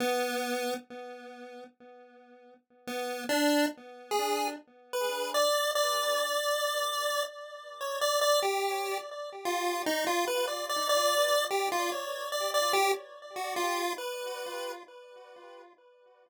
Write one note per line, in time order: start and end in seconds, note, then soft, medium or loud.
0.00 0.74 B3 loud
2.87 3.24 B3 medium
3.29 3.66 D4 loud
4.11 4.48 G#4 medium
4.93 5.30 B4 medium
5.34 5.71 D5 loud
5.75 7.23 D5 loud
7.81 7.99 C#5 medium
8.01 8.20 D5 loud
8.21 8.40 D5 loud
8.42 8.98 G4 medium
9.45 9.82 F4 medium
9.86 10.05 D#4 loud
10.07 10.25 F4 loud
10.27 10.46 B4 medium
10.47 10.66 D5 medium
10.69 10.88 D5 medium
10.89 11.45 D5 loud
11.51 11.69 G4 medium
11.72 11.90 F4 medium
11.92 12.29 C#5 soft
12.32 12.51 D5 medium
12.54 12.72 D5 loud
12.73 12.92 G4 loud
13.36 13.54 F#4 medium
13.56 13.93 F4 medium
13.98 14.72 B4 medium